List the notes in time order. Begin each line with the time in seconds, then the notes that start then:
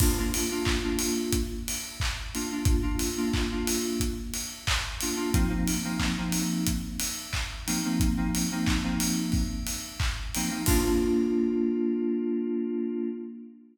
0.00 A#3 D4 F4, kick, crash
0.18 A#3 D4 F4
0.34 open hi-hat
0.51 A#3 D4 F4
0.65 kick, clap
0.83 A#3 D4 F4
0.99 open hi-hat
1.33 kick, closed hi-hat
1.68 open hi-hat
2.00 kick, clap
2.34 A#3 D4 F4, open hi-hat
2.51 A#3 D4 F4
2.65 kick, closed hi-hat
2.82 A#3 D4 F4
2.99 open hi-hat
3.17 A#3 D4 F4
3.33 kick, clap
3.51 A#3 D4 F4
3.67 open hi-hat
4.00 kick, closed hi-hat
4.34 open hi-hat
4.67 kick, clap
5.01 A#3 D4 F4, open hi-hat
5.16 A#3 D4 F4
5.33 F3 A#3 C4 D#4, kick, closed hi-hat
5.49 F3 A#3 C4 D#4
5.68 open hi-hat
5.84 F3 A#3 C4 D#4
5.99 kick, clap
6.18 F3 A#3 C4 D#4
6.32 open hi-hat
6.67 kick, closed hi-hat
7.00 open hi-hat
7.33 kick, clap
7.67 F3 A#3 C4 D#4, open hi-hat
7.84 F3 A#3 C4 D#4
8.00 kick, closed hi-hat
8.17 F3 A#3 C4 D#4
8.35 open hi-hat
8.51 F3 A#3 C4 D#4
8.67 kick, clap
8.84 F3 A#3 C4 D#4
9.00 open hi-hat
9.32 kick, open hi-hat
9.67 open hi-hat
10.00 kick, clap
10.35 F3 A#3 C4 D#4, open hi-hat
10.50 F3 A#3 C4 D#4
10.66 A#3 D4 F4, kick, crash